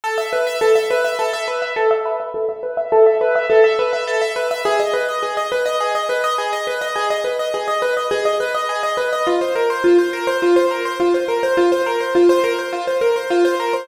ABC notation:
X:1
M:4/4
L:1/16
Q:1/4=104
K:G#m
V:1 name="Acoustic Grand Piano"
=A e B e A e B e A e B e A e B e | =A e B e A e B e A e B e A e B e | G d B d G d B d G d B d G d B d | G d B d G d B d G d B d G d B d |
^E ^B A B E B A B E B A B E B A B | ^E ^B A B E B A B E B A B E B A B |]